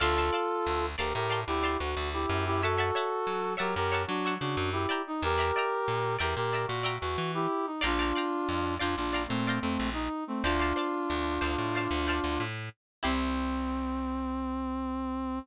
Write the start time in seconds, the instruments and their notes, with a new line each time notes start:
0.00 electric bass (finger) D2, brass section F4 A4, pizzicato strings D5 F5 A5 C6
0.17 pizzicato strings D5 F5 A5 C6
0.33 pizzicato strings D5 F5 A5 C6
0.66 electric bass (finger) D2
0.98 electric bass (finger) D2, brass section G4 A#4, pizzicato strings D5 F5 A5 C6
1.14 electric bass (finger) A2, brass section G4 A#4
1.30 pizzicato strings D5 F5 A5 C6
1.47 electric bass (finger) D2, brass section E4 G4
1.63 pizzicato strings D5 F5 A5 C6
1.78 electric bass (finger) D2, brass section F#4
1.97 electric bass (finger) D2
2.13 brass section E4 G4
2.29 electric bass (finger) F#2
2.46 brass section E4 G4
2.62 brass section F#4 A4, pizzicato strings C#5 E5 F#5 A5
2.77 pizzicato strings C#5 E5 F#5 A5
2.95 pizzicato strings C#5 E5 F#5 A5
3.27 electric bass (finger) F#3
3.57 electric bass (finger) F#3, brass section G4 A#4, pizzicato strings C#5 E5 F#5 A5
3.76 electric bass (finger) F#2, brass section G4 A#4
3.92 pizzicato strings C#5 E5 F#5 A5
4.07 electric bass (finger) F#3, brass section D4 F#4
4.25 pizzicato strings C#5 E5 F#5 A5
4.40 electric bass (finger) C#3, brass section D4 F#4
4.57 electric bass (finger) F#2
4.72 brass section E4 G4
4.89 pizzicato strings D5 E5 G5 A#5
5.07 brass section D#4
5.22 electric bass (finger) E2, brass section G4 A#4
5.38 pizzicato strings D5 E5 G5 A#5
5.56 pizzicato strings D5 E5 G5 A#5
5.88 electric bass (finger) A#2
6.19 electric bass (finger) E2, brass section G4 A#4, pizzicato strings D5 E5 G5 A#5
6.36 electric bass (finger) A#2, brass section G4 A#4
6.53 pizzicato strings D5 E5 G5 A#5
6.67 electric bass (finger) A#2, brass section F#4
6.83 pizzicato strings D5 E5 G5 A#5
7.01 electric bass (finger) E2, brass section F#4
7.18 electric bass (finger) E3
7.34 brass section E4 G4
7.66 brass section D#4
7.81 electric bass (finger) A#1, brass section D4 F4, pizzicato strings D5 F5 G5 A#5
7.99 pizzicato strings D5 F5 G5 A#5
8.15 pizzicato strings D5 F5 G5 A#5
8.49 electric bass (finger) F2
8.79 electric bass (finger) F2, brass section D4 F4, pizzicato strings D5 F5 G5 A#5
8.96 electric bass (finger) A#1, brass section D4 F4
9.13 pizzicato strings D5 F5 G5 A#5
9.28 electric bass (finger) A#2, brass section A3 C4
9.47 pizzicato strings D5 F5 G5 A#5
9.61 electric bass (finger) F2, brass section A3 C4
9.79 electric bass (finger) A#1
9.93 brass section D#4
10.27 brass section A3 C4
10.43 electric bass (finger) D2, brass section D4 F4, pizzicato strings C5 D5 F5 A5
10.59 pizzicato strings C5 D5 F5 A5
10.76 pizzicato strings C5 D5 F5 A5
11.10 electric bass (finger) D2
11.41 electric bass (finger) D2, pizzicato strings C5 D5 F5 A5
11.58 electric bass (finger) A2
11.75 pizzicato strings C5 D5 F5 A5
11.91 electric bass (finger) D2
12.07 pizzicato strings C5 D5 F5 A5
12.24 electric bass (finger) D2
12.40 electric bass (finger) A2
13.03 electric bass (finger) C2, brass section C4, pizzicato strings E4 G4 C5